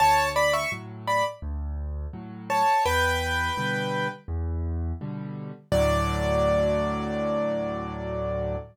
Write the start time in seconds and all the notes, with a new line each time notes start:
0.00 D2 C#5 A5
0.36 D5 B5
0.53 E5 C#6
0.72 A2 F#3
1.07 D5 B5
1.42 D2
2.13 A2 F#3
2.50 C#5 A5
2.85 E2 B4 G5
3.57 B2 D3 G3
4.28 E2
5.01 B2 D3 G3
5.72 D2 A2 F#3 D5